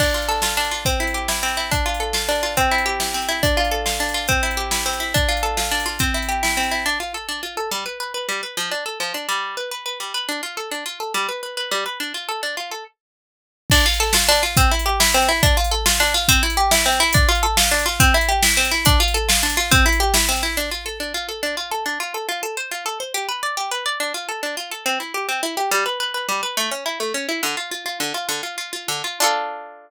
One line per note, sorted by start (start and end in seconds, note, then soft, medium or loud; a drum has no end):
0.00 0.57 D4 medium
0.00 kick loud
0.00 crash loud
0.14 0.42 F4 medium
0.22 closed hi-hat medium
0.29 0.83 A4 medium
0.42 0.71 F4 medium
0.42 snare loud
0.57 0.84 D4 loud
0.64 closed hi-hat medium
0.71 0.85 F4 medium
0.85 1.42 C4 medium
0.85 kick loud
0.85 closed hi-hat loud
1.00 1.28 E4 medium
1.07 closed hi-hat medium
1.14 1.69 G4 medium
1.28 1.57 E4 medium
1.28 snare loud
1.43 1.70 C4 medium
1.48 closed hi-hat medium
1.57 1.71 E4 medium
1.71 2.28 D4 medium
1.71 kick loud
1.71 closed hi-hat loud
1.86 2.14 F4 medium
1.94 closed hi-hat medium
2.00 2.54 A4 medium
2.13 2.42 F4 medium
2.13 snare loud
2.29 2.56 D4 medium
2.35 closed hi-hat medium
2.43 2.56 F4 medium
2.57 3.14 C4 loud
2.57 kick medium
2.57 closed hi-hat loud
2.71 3.00 E4 medium
2.78 closed hi-hat medium
2.86 3.40 G4 medium
3.00 3.28 E4 medium
3.00 snare loud
3.14 3.41 C4 medium
3.22 closed hi-hat medium
3.29 3.42 E4 medium
3.43 4.00 D4 medium
3.43 kick loud
3.43 closed hi-hat loud
3.57 3.85 F4 medium
3.65 closed hi-hat medium
3.71 4.26 A4 medium
3.86 4.14 F4 medium
3.86 snare loud
4.00 4.27 D4 medium
4.09 closed hi-hat medium
4.14 4.28 F4 medium
4.28 4.85 C4 loud
4.28 kick loud
4.28 closed hi-hat loud
4.43 4.71 E4 medium
4.51 closed hi-hat medium
4.57 5.11 G4 medium
4.71 5.00 E4 medium
4.71 snare loud
4.86 5.13 C4 medium
4.94 closed hi-hat medium
5.00 5.14 E4 medium
5.14 5.71 D4 loud
5.14 kick loud
5.14 closed hi-hat loud
5.29 5.57 F4 medium
5.37 closed hi-hat medium
5.43 5.97 A4 medium
5.57 5.85 F4 medium
5.57 snare loud
5.71 5.99 D4 medium
5.80 closed hi-hat medium
5.86 5.99 F4 medium
5.99 6.57 C4 loud
5.99 kick loud
5.99 closed hi-hat loud
6.14 6.42 E4 medium
6.22 closed hi-hat medium
6.29 6.83 G4 medium
6.43 6.71 E4 medium
6.43 snare loud
6.57 6.84 C4 medium
6.63 closed hi-hat medium
6.71 6.85 E4 medium
6.86 6.99 D4 medium
7.00 7.13 F4 medium
7.14 7.27 A4 medium
7.29 7.41 D4 medium
7.43 7.56 F4 medium
7.57 7.70 A4 medium
7.71 7.84 G3 medium
7.86 7.99 B4 medium
8.00 8.13 B4 medium
8.14 8.27 B4 medium
8.29 8.41 G3 medium
8.43 8.56 B4 medium
8.57 8.70 F3 medium
8.71 8.84 D4 medium
8.86 8.99 A4 medium
9.00 9.13 F3 medium
9.14 9.27 D4 medium
9.29 9.56 G3 medium
9.57 9.70 B4 medium
9.71 9.84 B4 medium
9.86 9.99 B4 medium
10.00 10.13 G3 medium
10.14 10.27 B4 medium
10.29 10.41 D4 medium
10.43 10.56 F4 medium
10.57 10.70 A4 medium
10.71 10.84 D4 medium
10.86 10.99 F4 medium
11.00 11.13 A4 medium
11.14 11.27 G3 medium
11.29 11.41 B4 medium
11.43 11.56 B4 medium
11.57 11.70 B4 medium
11.71 11.84 G3 medium
11.86 11.99 B4 medium
12.00 12.13 D4 medium
12.14 12.27 F4 medium
12.29 12.41 A4 medium
12.43 12.56 D4 medium
12.57 12.70 F4 medium
12.71 12.84 A4 medium
13.70 13.86 D4 loud
13.70 kick loud
13.70 crash loud
13.86 14.00 F4 medium
13.94 closed hi-hat medium
14.00 14.14 A4 loud
14.13 14.29 F4 loud
14.13 snare loud
14.29 14.43 D4 loud
14.35 closed hi-hat loud
14.43 14.56 F4 medium
14.57 14.71 C4 loud
14.57 kick loud
14.57 closed hi-hat loud
14.71 14.86 E4 medium
14.79 closed hi-hat loud
14.86 15.00 G4 medium
15.00 15.14 E4 loud
15.00 snare loud
15.14 15.29 C4 loud
15.22 closed hi-hat medium
15.29 15.42 E4 loud
15.43 15.57 D4 loud
15.43 kick loud
15.43 closed hi-hat loud
15.57 15.71 F4 loud
15.64 closed hi-hat loud
15.71 15.86 A4 medium
15.86 16.00 F4 loud
15.86 snare loud
16.00 16.14 D4 loud
16.07 closed hi-hat medium
16.14 16.28 F4 loud
16.28 16.43 C4 loud
16.28 kick loud
16.28 closed hi-hat loud
16.43 16.57 E4 medium
16.50 closed hi-hat loud
16.57 16.71 G4 loud
16.71 16.86 E4 medium
16.71 snare loud
16.86 17.00 C4 loud
16.92 closed hi-hat medium
17.00 17.14 E4 loud
17.13 17.29 D4 loud
17.13 kick loud
17.13 closed hi-hat loud
17.29 17.43 F4 loud
17.35 closed hi-hat medium
17.43 17.57 A4 loud
17.57 17.71 F4 medium
17.57 snare loud
17.71 17.86 D4 loud
17.79 closed hi-hat loud
17.86 17.99 F4 loud
18.00 18.14 C4 loud
18.00 kick loud
18.00 closed hi-hat loud
18.14 18.29 E4 loud
18.21 closed hi-hat loud
18.29 18.43 G4 loud
18.42 18.57 E4 medium
18.42 snare loud
18.57 18.71 C4 loud
18.65 closed hi-hat loud
18.71 18.85 E4 loud
18.85 19.00 D4 loud
18.85 kick loud
18.85 closed hi-hat loud
19.00 19.14 F4 loud
19.08 closed hi-hat medium
19.14 19.29 A4 loud
19.29 19.43 F4 medium
19.29 snare loud
19.43 19.57 D4 loud
19.50 closed hi-hat loud
19.57 19.71 F4 loud
19.71 19.86 C4 loud
19.71 kick loud
19.71 closed hi-hat loud
19.86 20.00 E4 loud
19.92 closed hi-hat loud
20.00 20.14 G4 loud
20.14 20.29 E4 medium
20.14 snare loud
20.29 20.43 C4 loud
20.36 closed hi-hat medium
20.43 20.56 E4 medium
20.57 20.70 D4 medium
20.71 20.84 F4 medium
20.86 20.99 A4 medium
21.00 21.13 D4 medium
21.14 21.27 F4 medium
21.29 21.41 A4 medium
21.43 21.56 D4 medium
21.57 21.70 F4 medium
21.71 21.84 A4 medium
21.86 21.99 D4 medium
22.00 22.13 F4 medium
22.14 22.27 A4 medium
22.29 22.41 F4 medium
22.43 22.56 A4 medium
22.57 22.70 C5 medium
22.71 22.84 F4 medium
22.86 22.99 A4 medium
23.00 23.13 C5 medium
23.14 23.27 G4 loud
23.29 23.41 B4 medium
23.43 23.56 D5 medium
23.57 23.70 G4 medium
23.71 23.84 B4 medium
23.86 23.99 D5 medium
24.00 24.13 D4 medium
24.14 24.27 F4 medium
24.29 24.41 A4 medium
24.43 24.56 D4 medium
24.57 24.70 F4 medium
24.71 24.84 A4 medium
24.86 24.99 C4 medium
25.00 25.13 E4 medium
25.14 25.27 G4 medium
25.29 25.41 C4 medium
25.43 25.56 E4 medium
25.57 25.70 G4 medium
25.71 25.84 G3 loud
25.86 25.99 B4 medium
26.00 26.13 B4 medium
26.14 26.27 B4 medium
26.29 26.41 G3 medium
26.43 26.56 B4 medium
26.57 26.70 A3 medium
26.71 26.84 C#4 medium
26.86 26.99 E4 medium
27.00 27.13 A3 medium
27.14 27.27 C#4 medium
27.29 27.41 E4 medium
27.43 27.56 D3 medium
27.57 27.70 F4 medium
27.71 27.84 F4 medium
27.86 27.99 F4 medium
28.00 28.13 D3 medium
28.14 28.27 F4 medium
28.29 28.42 D3 medium
28.43 28.56 F4 medium
28.58 28.71 F4 medium
28.73 28.87 F4 medium
28.88 29.02 D3 medium
29.04 29.19 F4 medium
29.20 29.90 D4 loud
29.20 29.90 F4 loud
29.20 29.90 A4 loud